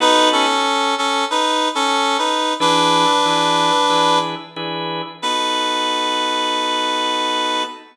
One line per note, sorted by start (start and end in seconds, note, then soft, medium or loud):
0.00 0.46 B3 loud
0.00 0.46 D#4 loud
0.00 0.29 D#4 loud
0.00 0.46 F#4 loud
0.00 0.46 A4 loud
0.00 0.29 B4 loud
0.32 0.95 C#4 medium
0.32 0.95 A4 loud
0.98 1.25 C#4 medium
0.98 1.25 A4 medium
1.30 1.69 D#4 medium
1.30 1.69 B4 loud
1.75 2.17 C#4 medium
1.75 2.17 A4 loud
2.18 2.54 D#4 medium
2.18 2.54 B4 medium
2.60 3.06 E3 loud
2.60 3.06 D4 loud
2.60 4.19 D4 loud
2.60 3.06 G#4 loud
2.60 3.06 B4 loud
2.60 4.19 B4 loud
3.25 3.71 E3 loud
3.25 3.71 D4 medium
3.25 3.71 G#4 medium
3.25 3.71 B4 medium
3.90 4.35 E3 loud
3.90 4.35 D4 medium
3.90 4.35 G#4 loud
3.90 4.35 B4 loud
4.56 5.02 E3 loud
4.56 5.02 D4 medium
4.56 5.02 G#4 loud
4.56 5.02 B4 loud
5.22 7.63 B3 loud
5.22 7.63 D#4 loud
5.22 7.63 F#4 medium
5.22 7.63 A4 loud
5.22 7.63 B4 loud